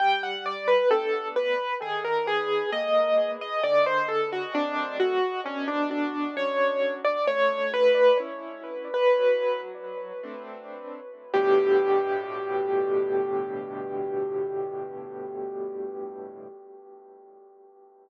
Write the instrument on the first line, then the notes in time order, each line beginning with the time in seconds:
acoustic grand piano
0.00 G3 G5
0.23 F#5
0.46 D5
0.68 B4
0.91 A3 B3 D4 A4
1.36 B4
1.82 D#3 G#4
2.05 A#4
2.27 G#4
2.72 G#3 A#3 D#5
3.41 D#5
3.63 D3 D5
3.86 C5
4.08 A4
4.33 F#4
4.55 F#3 A3 C4 D4
5.00 F#4
5.46 B2 C#4
5.68 D4
5.91 D4
6.37 F#3 C#4 D4 C#5
7.05 D5
7.27 A3 C#5
7.74 B4
8.20 C#4 E4
8.94 B4
9.19 F#3
10.23 A3 C4 D4
11.34 G2 A2 B2 D3 G4